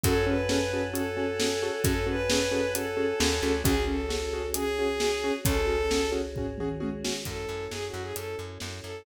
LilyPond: <<
  \new Staff \with { instrumentName = "Violin" } { \time 4/4 \key fis \dorian \tempo 4 = 133 a'8 b'4. a'2 | a'8 b'4. a'2 | gis'8 a'4. gis'2 | a'4. r2 r8 |
a'4 \tuplet 3/2 { gis'8 fis'8 gis'8 } a'8 r4 a'8 | }
  \new Staff \with { instrumentName = "Acoustic Grand Piano" } { \time 4/4 \key fis \dorian <cis' fis' gis' a'>8 <cis' fis' gis' a'>8 <cis' fis' gis' a'>8 <cis' fis' gis' a'>8 <cis' fis' gis' a'>8 <cis' fis' gis' a'>8 <cis' fis' gis' a'>8 <cis' fis' gis' a'>8 | <cis' fis' gis' a'>8 <cis' fis' gis' a'>8 <cis' fis' gis' a'>8 <cis' fis' gis' a'>8 <cis' fis' gis' a'>8 <cis' fis' gis' a'>8 <cis' fis' gis' a'>8 <cis' fis' gis' a'>8 | <cis' fis' gis'>8 <cis' fis' gis'>8 <cis' fis' gis'>8 <cis' fis' gis'>8 <cis' fis' gis'>8 <cis' fis' gis'>8 <cis' fis' gis'>8 <cis' fis' gis'>8 | <cis' fis' gis'>8 <cis' fis' gis'>8 <cis' fis' gis'>8 <cis' fis' gis'>8 <cis' fis' gis'>8 <cis' fis' gis'>8 <cis' fis' gis'>8 <cis' fis' gis'>8 |
r1 | }
  \new Staff \with { instrumentName = "Electric Bass (finger)" } { \clef bass \time 4/4 \key fis \dorian fis,1 | fis,2. dis,8 d,8 | cis,1 | cis,1 |
fis,8 fis,8 fis,8 fis,8 fis,8 fis,8 fis,8 fis,8 | }
  \new Staff \with { instrumentName = "Choir Aahs" } { \time 4/4 \key fis \dorian <cis'' fis'' gis'' a''>1~ | <cis'' fis'' gis'' a''>1 | <cis' fis' gis'>1~ | <cis' fis' gis'>1 |
<cis' e' fis' a'>1 | }
  \new DrumStaff \with { instrumentName = "Drums" } \drummode { \time 4/4 <hh bd>4 sn4 hh4 sn4 | <hh bd>4 sn4 hh4 sn4 | <hh bd>4 sn4 hh4 sn4 | <hh bd>4 sn4 <bd tomfh>8 toml8 tommh8 sn8 |
<hh bd>4 sn4 hh4 sn4 | }
>>